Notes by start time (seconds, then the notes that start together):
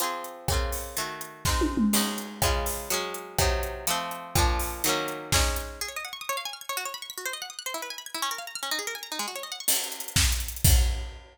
0.00 F3 C4 G#4, closed hi-hat
0.24 closed hi-hat
0.48 C#3 A#3 C4, kick, cross-stick
0.53 F4
0.72 open hi-hat
0.97 D#3 A3 F#4, closed hi-hat
1.21 closed hi-hat
1.45 G#3 C4 D#4, kick, snare
1.61 high tom
1.77 mid tom
1.93 G#3 C#4 D#4, crash
2.18 closed hi-hat
2.42 C#3 G#3 F4, kick, cross-stick
2.66 open hi-hat
2.90 F#3 G#3 C#4, closed hi-hat
3.14 closed hi-hat
3.38 C3 F#3 D#4, kick, cross-stick
3.63 closed hi-hat
3.87 F3 A3 C4, closed hi-hat
4.11 closed hi-hat
4.35 A#2 F3 D4, kick, cross-stick
4.59 open hi-hat
4.84 D#3 F#3 A#3, closed hi-hat
4.89 C#4
5.08 closed hi-hat
5.32 G#3 C#4 D#4, kick, snare
5.56 closed hi-hat
5.81 G#4
5.88 C#5
5.96 D#5
6.05 F#5
6.13 C#6
6.21 D#6
6.29 C#5
6.37 F5
6.45 G#5
6.53 F6
6.61 G#6
6.69 C#5
6.77 F#4
6.85 C#5
6.94 B5
7.02 C#6
7.10 B6
7.18 F#4
7.26 C5
7.33 D#5
7.42 F#5
7.50 D#6
7.59 F#6
7.66 C5
7.74 E4
7.82 B4
7.90 G#5
7.98 B5
8.06 G#6
8.14 E4
8.22 C#4
8.31 A#4
8.38 F5
8.47 A#5
8.55 F6
8.63 C#4
8.71 D#4
8.79 G#4
8.87 A#4
8.95 G#5
9.03 A#5
9.12 D#4
9.19 G#3
9.28 F#4
9.36 C#5
9.43 D#5
9.52 F#5
9.60 C#6
9.68 crash
9.76 closed hi-hat
9.84 closed hi-hat
9.92 closed hi-hat
10.00 closed hi-hat
10.08 closed hi-hat
10.16 kick, snare
10.24 closed hi-hat
10.32 closed hi-hat
10.40 closed hi-hat
10.48 closed hi-hat
10.56 closed hi-hat
10.64 kick, crash